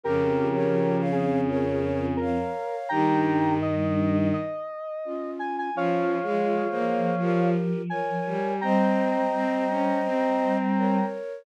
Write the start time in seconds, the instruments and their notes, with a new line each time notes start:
0.04 choir aahs F2, violin C#3, flute G4 A#4, lead 1 (square) G4 A#4
0.54 flute A#4 C#5
1.00 flute C#5 F5
1.12 lead 1 (square) G#4
1.48 flute A#4 C#5
2.17 lead 1 (square) A#4
2.21 flute C#5 F5
2.89 choir aahs G2, violin D#3, flute D#4 G4, lead 1 (square) G5 A#5
3.62 lead 1 (square) D#5
4.33 lead 1 (square) D#5
5.05 flute C#4 F4
5.39 lead 1 (square) G#5
5.58 lead 1 (square) G#5
5.74 choir aahs F3, violin F3, flute C#4 F4, lead 1 (square) C#5 F5
6.23 violin G#3, flute F4 G#4
6.69 violin A#3, flute G#4 C5
7.18 violin F3, flute G4 A#4
7.90 flute A#4 C#5, lead 1 (square) G#5
8.26 violin G3
8.61 choir aahs G3, violin C4, flute C5 D#5, lead 1 (square) G5 A#5
9.33 violin C4
9.69 violin C#4
10.04 violin C4
10.77 flute A#4 C#5